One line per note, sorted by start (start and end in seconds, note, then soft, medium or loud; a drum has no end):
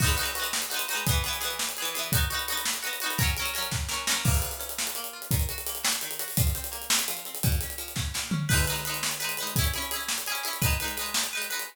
0.00 0.16 D#4 loud
0.00 0.16 F#4 loud
0.00 kick loud
0.00 crash loud
0.04 0.16 G#3 loud
0.04 0.16 B3 loud
0.09 closed hi-hat medium
0.17 0.33 D#4 medium
0.17 0.33 F#4 medium
0.17 closed hi-hat medium
0.21 0.33 G#3 medium
0.21 0.33 B3 medium
0.26 closed hi-hat medium
0.35 0.68 D#4 medium
0.35 0.68 F#4 medium
0.35 closed hi-hat medium
0.40 0.68 G#3 medium
0.40 0.68 B3 medium
0.44 closed hi-hat medium
0.53 snare loud
0.62 closed hi-hat medium
0.70 0.86 D#4 medium
0.70 0.86 F#4 medium
0.70 closed hi-hat medium
0.74 0.86 G#3 medium
0.74 0.86 B3 medium
0.79 closed hi-hat medium
0.88 1.05 D#4 loud
0.88 1.05 F#4 medium
0.88 closed hi-hat medium
0.93 1.05 G#3 medium
0.93 1.05 B3 medium
0.97 closed hi-hat medium
1.07 1.23 B3 loud
1.07 1.23 G#4 loud
1.07 kick loud
1.07 closed hi-hat loud
1.11 1.23 E3 loud
1.15 closed hi-hat medium
1.24 1.40 B3 medium
1.24 1.40 G#4 medium
1.24 closed hi-hat medium
1.28 1.40 E3 medium
1.33 closed hi-hat medium
1.41 1.73 B3 medium
1.41 1.73 G#4 loud
1.41 closed hi-hat medium
1.45 1.73 E3 medium
1.50 closed hi-hat medium
1.59 snare loud
1.69 closed hi-hat medium
1.77 1.94 B3 medium
1.77 1.94 G#4 medium
1.77 closed hi-hat medium
1.82 1.94 E3 loud
1.82 closed hi-hat medium
1.94 2.11 B3 medium
1.94 2.11 G#4 medium
1.94 closed hi-hat medium
1.99 2.11 E3 medium
2.03 closed hi-hat medium
2.12 2.29 D#4 loud
2.12 2.29 F#4 loud
2.12 kick loud
2.12 closed hi-hat loud
2.17 2.29 B3 medium
2.21 closed hi-hat medium
2.30 2.46 D#4 medium
2.30 2.46 F#4 medium
2.30 closed hi-hat medium
2.34 2.46 B3 medium
2.39 closed hi-hat medium
2.48 2.81 D#4 medium
2.48 2.81 F#4 medium
2.48 closed hi-hat medium
2.52 2.81 B3 loud
2.57 closed hi-hat medium
2.65 snare loud
2.73 closed hi-hat medium
2.83 2.99 D#4 medium
2.83 2.99 F#4 medium
2.83 closed hi-hat medium
2.87 2.99 B3 medium
2.93 closed hi-hat medium
3.00 3.18 D#4 loud
3.00 3.18 F#4 medium
3.00 closed hi-hat medium
3.06 3.18 B3 medium
3.10 closed hi-hat medium
3.18 3.35 C#4 medium
3.18 3.35 A#4 loud
3.18 kick loud
3.18 closed hi-hat loud
3.22 3.35 F#3 loud
3.27 closed hi-hat medium
3.37 3.54 C#4 medium
3.37 3.53 A#4 loud
3.37 closed hi-hat medium
3.42 3.54 F#3 medium
3.42 closed hi-hat medium
3.54 3.86 C#4 loud
3.54 3.86 A#4 medium
3.54 closed hi-hat medium
3.58 3.86 F#3 medium
3.63 closed hi-hat medium
3.72 kick medium
3.72 snare medium
3.89 4.06 C#4 medium
3.89 4.06 A#4 medium
3.89 snare medium
3.93 4.06 F#3 medium
4.07 4.23 C#4 medium
4.07 4.23 A#4 medium
4.07 snare loud
4.11 4.23 F#3 medium
4.25 4.95 A#3 medium
4.25 kick loud
4.25 crash loud
4.34 closed hi-hat medium
4.42 4.79 F4 medium
4.42 closed hi-hat medium
4.51 closed hi-hat medium
4.59 5.27 C#4 medium
4.59 closed hi-hat medium
4.69 closed hi-hat medium
4.78 5.13 F4 medium
4.78 snare loud
4.87 closed hi-hat medium
4.95 5.29 A#3 medium
4.95 closed hi-hat medium
5.04 closed hi-hat medium
5.13 5.30 F4 medium
5.22 closed hi-hat medium
5.31 6.02 D#3 medium
5.31 kick loud
5.31 closed hi-hat loud
5.40 closed hi-hat medium
5.49 5.83 F#4 medium
5.49 closed hi-hat medium
5.58 closed hi-hat medium
5.67 6.34 A#3 medium
5.67 closed hi-hat medium
5.75 closed hi-hat medium
5.83 6.19 F#4 medium
5.83 snare loud
5.92 closed hi-hat medium
6.01 6.36 D#3 medium
6.01 closed hi-hat medium
6.11 closed hi-hat medium
6.19 6.36 F#4 medium
6.19 closed hi-hat medium
6.28 open hi-hat medium
6.37 7.08 F3 medium
6.37 kick loud
6.37 closed hi-hat loud
6.47 closed hi-hat medium
6.55 6.90 C4 medium
6.55 closed hi-hat medium
6.64 closed hi-hat medium
6.72 7.39 A#3 medium
6.72 closed hi-hat medium
6.82 closed hi-hat medium
6.90 7.26 C4 medium
6.90 snare loud
6.99 closed hi-hat medium
7.08 7.42 F3 medium
7.08 closed hi-hat medium
7.17 closed hi-hat medium
7.25 7.43 C4 medium
7.25 closed hi-hat medium
7.35 closed hi-hat medium
7.43 8.14 A#2 medium
7.43 kick loud
7.43 closed hi-hat loud
7.52 closed hi-hat medium
7.61 7.96 C#4 soft
7.61 closed hi-hat medium
7.70 closed hi-hat medium
7.78 8.45 F3 medium
7.78 closed hi-hat medium
7.88 closed hi-hat medium
7.96 8.31 C#4 medium
7.96 kick medium
7.96 snare medium
8.14 8.48 A#2 medium
8.14 snare medium
8.31 8.48 C#4 medium
8.31 floor tom loud
8.49 8.65 D#4 loud
8.49 8.65 B4 loud
8.49 kick loud
8.49 crash loud
8.53 8.65 G#3 loud
8.58 closed hi-hat medium
8.67 8.84 D#4 medium
8.67 8.84 B4 medium
8.67 closed hi-hat medium
8.72 8.84 G#3 medium
8.72 closed hi-hat medium
8.85 9.18 D#4 medium
8.85 9.18 B4 medium
8.85 closed hi-hat medium
8.89 9.18 G#3 medium
8.94 closed hi-hat medium
9.03 snare loud
9.11 closed hi-hat medium
9.20 9.36 D#4 medium
9.20 9.36 B4 medium
9.20 closed hi-hat medium
9.24 9.36 G#3 medium
9.29 closed hi-hat medium
9.37 9.55 D#4 medium
9.37 9.55 B4 medium
9.37 closed hi-hat medium
9.43 9.55 G#3 medium
9.47 closed hi-hat medium
9.56 9.73 E4 loud
9.56 9.73 G#4 medium
9.56 kick loud
9.56 closed hi-hat loud
9.61 9.73 C#4 loud
9.61 closed hi-hat medium
9.74 9.90 E4 medium
9.74 9.90 G#4 medium
9.74 closed hi-hat medium
9.78 9.90 C#4 medium
9.82 closed hi-hat medium
9.91 10.24 E4 medium
9.91 10.24 G#4 medium
9.91 closed hi-hat medium
9.96 10.24 C#4 medium
10.01 closed hi-hat medium
10.08 snare loud
10.18 closed hi-hat medium
10.26 10.44 E4 medium
10.26 10.43 G#4 loud
10.26 closed hi-hat medium
10.32 10.44 C#4 medium
10.32 closed hi-hat medium
10.43 10.60 E4 medium
10.43 10.60 G#4 medium
10.43 closed hi-hat medium
10.48 10.60 C#4 medium
10.53 closed hi-hat medium
10.62 10.78 D#4 loud
10.62 10.78 B4 loud
10.62 kick loud
10.62 closed hi-hat loud
10.66 10.78 G#3 loud
10.70 closed hi-hat medium
10.80 10.96 D#4 medium
10.80 10.96 B4 medium
10.80 closed hi-hat medium
10.84 10.96 G#3 loud
10.84 closed hi-hat medium
10.97 11.29 D#4 medium
10.97 11.29 B4 medium
10.97 closed hi-hat medium
11.01 11.29 G#3 medium
11.06 closed hi-hat medium
11.14 snare loud
11.23 closed hi-hat medium
11.33 11.49 D#4 medium
11.33 11.49 B4 medium
11.37 11.49 G#3 medium
11.42 closed hi-hat medium
11.50 11.66 D#4 medium
11.50 11.66 B4 medium
11.50 closed hi-hat medium
11.54 11.66 G#3 medium
11.59 closed hi-hat medium